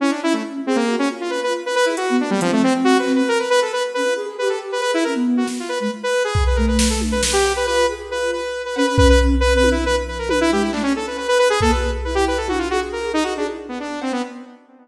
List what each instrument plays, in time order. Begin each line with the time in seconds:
0.00 lead 2 (sawtooth) C#4, flute E4
0.11 lead 2 (sawtooth) D4
0.22 flute C#4, lead 2 (sawtooth) E4
0.33 lead 2 (sawtooth) A3
0.66 lead 2 (sawtooth) C4, flute G#4
0.76 lead 2 (sawtooth) A#3
0.88 flute F#4
0.99 lead 2 (sawtooth) C#4
1.10 flute F4
1.21 lead 2 (sawtooth) F4
1.30 lead 2 (sawtooth) B4
1.43 lead 2 (sawtooth) B4
1.66 lead 2 (sawtooth) B4
1.75 lead 2 (sawtooth) B4
1.85 lead 2 (sawtooth) E4, flute G#4
1.97 lead 2 (sawtooth) F#4, flute F#4, closed hi-hat
2.09 flute B3
2.19 flute A#3, lead 2 (sawtooth) D4
2.30 lead 2 (sawtooth) G3
2.41 lead 2 (sawtooth) F3, flute C4, closed hi-hat
2.52 lead 2 (sawtooth) A3
2.63 lead 2 (sawtooth) C4
2.84 lead 2 (sawtooth) F#4
2.99 lead 2 (sawtooth) B4
3.07 clap
3.15 lead 2 (sawtooth) B4
3.28 lead 2 (sawtooth) A#4
3.39 lead 2 (sawtooth) B4
3.50 lead 2 (sawtooth) B4
3.62 lead 2 (sawtooth) A4
3.73 lead 2 (sawtooth) B4
3.94 flute C#4, lead 2 (sawtooth) B4
4.05 flute F4
4.16 flute G#4
4.26 flute G#4
4.38 flute G4, lead 2 (sawtooth) B4
4.49 lead 2 (sawtooth) A4
4.72 lead 2 (sawtooth) B4
4.81 flute G#4, lead 2 (sawtooth) B4, closed hi-hat
4.94 lead 2 (sawtooth) E4
5.04 flute C#4, lead 2 (sawtooth) A#4
5.15 flute B3
5.37 lead 2 (sawtooth) F#4
5.47 snare
5.60 lead 2 (sawtooth) F4
5.69 lead 2 (sawtooth) B4
5.80 flute G#3, lead 2 (sawtooth) B4
6.03 lead 2 (sawtooth) B4
6.24 lead 2 (sawtooth) G#4
6.35 kick
6.47 lead 2 (sawtooth) B4
6.56 flute A3, lead 2 (sawtooth) A#4
6.67 lead 2 (sawtooth) B4
6.79 lead 2 (sawtooth) B4, snare
6.90 lead 2 (sawtooth) A4
7.01 high tom
7.11 lead 2 (sawtooth) B4
7.23 lead 2 (sawtooth) B4, snare
7.33 lead 2 (sawtooth) G4
7.45 cowbell
7.56 lead 2 (sawtooth) B4
7.66 flute F4, lead 2 (sawtooth) B4
7.89 flute G#4
8.10 flute F4, lead 2 (sawtooth) B4
8.32 lead 2 (sawtooth) B4
8.65 lead 2 (sawtooth) B4
8.76 flute C#4, lead 2 (sawtooth) B4, cowbell
8.86 lead 2 (sawtooth) B4
8.97 lead 2 (sawtooth) B4, kick
9.09 lead 2 (sawtooth) B4
9.40 lead 2 (sawtooth) B4
9.53 flute C4, lead 2 (sawtooth) B4
9.64 high tom
9.71 lead 2 (sawtooth) E4
9.85 flute F3, lead 2 (sawtooth) B4
10.08 lead 2 (sawtooth) B4
10.18 lead 2 (sawtooth) A#4
10.29 lead 2 (sawtooth) B4, high tom
10.41 lead 2 (sawtooth) E4
10.50 flute G#3, lead 2 (sawtooth) G4
10.61 lead 2 (sawtooth) E4
10.73 flute A3, lead 2 (sawtooth) D4, clap
10.83 flute C#4, lead 2 (sawtooth) C#4
10.96 lead 2 (sawtooth) A4
11.07 lead 2 (sawtooth) B4
11.17 lead 2 (sawtooth) B4, cowbell
11.28 lead 2 (sawtooth) B4
11.38 lead 2 (sawtooth) B4, cowbell
11.50 lead 2 (sawtooth) G#4
11.61 flute A#3, lead 2 (sawtooth) A4, kick
11.71 flute F#4, lead 2 (sawtooth) B4
11.83 flute G#4
12.04 flute E4, lead 2 (sawtooth) B4
12.15 lead 2 (sawtooth) G4
12.27 lead 2 (sawtooth) B4
12.37 lead 2 (sawtooth) A4
12.48 lead 2 (sawtooth) F#4, high tom
12.58 lead 2 (sawtooth) F4
12.70 lead 2 (sawtooth) F#4, flute G#4
12.92 lead 2 (sawtooth) A#4
13.13 lead 2 (sawtooth) D#4, flute G#4
13.23 lead 2 (sawtooth) F#4
13.36 lead 2 (sawtooth) D4, flute G#4
13.48 flute E4
13.68 lead 2 (sawtooth) B3
13.80 lead 2 (sawtooth) D4
14.01 lead 2 (sawtooth) C4, cowbell
14.12 lead 2 (sawtooth) B3